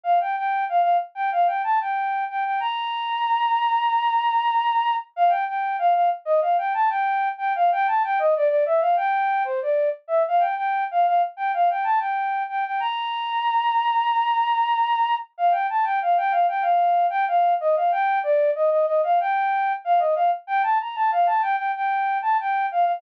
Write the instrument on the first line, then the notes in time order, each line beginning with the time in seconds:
flute
0.04 F5
0.21 G5
0.37 G5
0.69 F5
0.82 F5
1.15 G5
1.32 F5
1.47 G5
1.64 A5
1.81 G5
2.30 G5
2.45 G5
2.60 A#5
5.16 F5
5.29 G5
5.48 G5
5.79 F5
5.94 F5
6.25 D#5
6.41 F5
6.58 G5
6.74 A5
6.90 G5
7.38 G5
7.55 F5
7.72 G5
7.87 A5
8.04 G5
8.19 D#5
8.36 D5
8.49 D5
8.66 E5
8.81 F5
8.96 G5
9.45 C5
9.62 D5
10.08 E5
10.28 F5
10.40 G5
10.57 G5
10.91 F5
11.07 F5
11.37 G5
11.54 F5
11.70 G5
11.84 A5
12.00 G5
12.49 G5
12.65 G5
12.80 A#5
15.38 F5
15.52 G5
15.70 A5
15.84 G5
16.02 F5
16.17 G5
16.31 F5
16.48 G5
16.62 F5
17.10 G5
17.28 F5
17.61 D#5
17.76 F5
17.92 G5
18.23 D5
18.55 D#5
18.71 D#5
18.86 D#5
19.04 F5
19.20 G5
19.85 F5
19.99 D#5
20.15 F5
20.47 G5
20.63 A5
20.81 A#5
20.96 A5
21.12 F5
21.27 A5
21.42 G5
21.57 G5
21.75 G5
22.22 A5
22.40 G5
22.72 F5
22.85 F5